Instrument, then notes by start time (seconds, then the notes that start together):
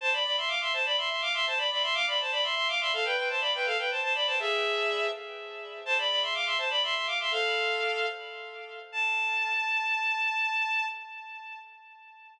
violin
0.01 C5 A5
0.13 D5 B5
0.25 D5 B5
0.37 E5 C6
0.48 F5 D6
0.61 E5 C6
0.73 C5 A5
0.85 D5 B5
0.97 E5 C6
1.10 E5 C6
1.21 F5 D6
1.34 E5 C6
1.47 C5 A5
1.58 D5 B5
1.71 D5 B5
1.83 E5 C6
1.94 F5 D6
2.07 D5 B5
2.21 C5 A5
2.32 D5 B5
2.43 E5 C6
2.56 E5 C6
2.68 F5 D6
2.80 E5 C6
2.93 A4 F5
3.05 B4 G5
3.17 B4 G5
3.29 C5 A5
3.40 D5 B5
3.55 B4 G5
3.66 A4 F5
3.78 B4 G5
3.91 C5 A5
4.02 C5 A5
4.15 D5 B5
4.27 C5 A5
4.40 G#4 E5
5.85 C5 A5
5.98 D5 B5
6.10 D5 B5
6.22 E5 C6
6.34 F5 D6
6.46 E5 C6
6.58 C5 A5
6.70 D5 B5
6.84 E5 C6
6.95 E5 C6
7.07 F5 D6
7.20 E5 C6
7.31 A4 F5
8.92 A5